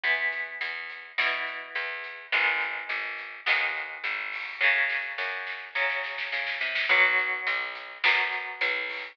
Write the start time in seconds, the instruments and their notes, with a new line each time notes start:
0.04 electric bass (finger) E2, overdriven guitar E3 B3, kick, closed hi-hat
0.32 kick, closed hi-hat
0.61 electric bass (finger) E2, closed hi-hat
0.90 closed hi-hat
1.18 electric bass (finger) B2, overdriven guitar E3 B3, snare
1.47 closed hi-hat
1.75 electric bass (finger) E2, closed hi-hat
2.04 closed hi-hat
2.32 electric bass (finger) G#1, overdriven guitar D#3 G#3 B3, kick, closed hi-hat
2.61 closed hi-hat
2.89 electric bass (finger) G#1, closed hi-hat
3.18 closed hi-hat
3.46 electric bass (finger) D#2, overdriven guitar D#3 G#3 B3, snare
3.75 closed hi-hat
4.04 electric bass (finger) G#1, closed hi-hat
4.32 kick, open hi-hat
4.61 electric bass (finger) F#2, overdriven guitar C#3 F#3, kick, snare
4.90 snare
5.18 electric bass (finger) F#2, snare
5.47 snare
5.75 electric bass (finger) C#3, overdriven guitar C#3 F#3, snare
5.90 snare
6.04 snare
6.18 snare
6.32 electric bass (finger) C#3, snare
6.47 snare
6.61 electric bass (finger) C3, snare
6.75 snare
6.89 electric bass (finger) B1, overdriven guitar F#3 B3, kick, closed hi-hat
7.18 closed hi-hat
7.47 electric bass (finger) B1, closed hi-hat
7.75 closed hi-hat
8.04 electric bass (finger) F#2, overdriven guitar F#3 B3, snare
8.32 closed hi-hat
8.61 electric bass (finger) B1, closed hi-hat
8.89 kick, open hi-hat